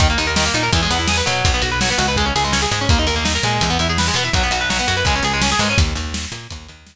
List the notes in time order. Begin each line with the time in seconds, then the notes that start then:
0.00 D#2 D#3, kick, closed hi-hat
0.10 A#3
0.18 D#2 D#4, closed hi-hat
0.27 A#4
0.36 D#3, snare
0.46 A#3
0.54 A#2 D#4, closed hi-hat
0.63 A#4
0.73 E2 E3, kick, closed hi-hat
0.82 G#3
0.90 E2 B3, closed hi-hat
0.99 E4
1.08 G#4, snare
1.17 B4
1.26 B2 F#3, closed hi-hat
1.45 B1, kick, closed hi-hat
1.54 B3
1.62 B1 F#4, closed hi-hat
1.71 B4
1.81 F#3, snare
1.90 B3
1.98 C#2 F#4, closed hi-hat
2.08 B4
2.16 G#3, kick, closed hi-hat
2.26 C#4
2.36 C#2 G#4, closed hi-hat
2.44 G#3
2.52 C#4, snare
2.62 G#4
2.71 G#2 G#3, closed hi-hat
2.81 C#4
2.89 D#2 A#3, kick, closed hi-hat
2.99 D#4
3.07 D#2 A#4, closed hi-hat
3.16 A#3
3.24 D#4, snare
3.35 A#4
3.43 A#2 G#3, closed hi-hat
3.61 E2, kick, closed hi-hat
3.70 B3
3.79 E2 E4, closed hi-hat
3.89 G#4
3.98 B4, snare
4.08 G#3
4.14 B2 B3, closed hi-hat
4.24 E4
4.33 B1 F#3, kick, closed hi-hat
4.43 B3
4.51 B1 F#4, closed hi-hat
4.61 B4
4.70 F#3, snare
4.79 B3
4.87 F#2 F#4, closed hi-hat
4.97 B4
5.05 C#2 G#3, kick, closed hi-hat
5.15 C#4
5.23 C#2 G#4, closed hi-hat
5.33 G#3
5.42 C#4, snare
5.52 G#4
5.59 G#2 G#3, open hi-hat
5.70 C#4
5.78 D#2, kick, closed hi-hat
5.95 D#2, closed hi-hat
6.14 snare
6.32 A#2, closed hi-hat
6.50 D#2, kick, closed hi-hat
6.68 D#2, closed hi-hat
6.87 snare